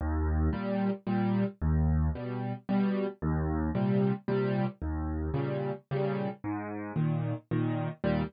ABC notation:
X:1
M:3/4
L:1/8
Q:1/4=112
K:Eb
V:1 name="Acoustic Grand Piano" clef=bass
E,,2 [B,,G,]2 [B,,G,]2 | E,,2 [=B,,G,]2 [B,,G,]2 | E,,2 [B,,C,G,]2 [B,,C,G,]2 | E,,2 [B,,_D,G,]2 [B,,D,G,]2 |
A,,2 [B,,E,]2 [B,,E,]2 | [E,,B,,G,]2 z4 |]